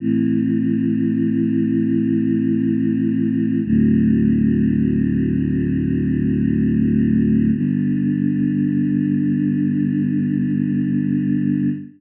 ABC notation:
X:1
M:4/4
L:1/8
Q:1/4=66
K:G
V:1 name="Choir Aahs"
[A,,E,C]8 | "^rit." [D,,A,,F,C]8 | [G,,D,B,]8 |]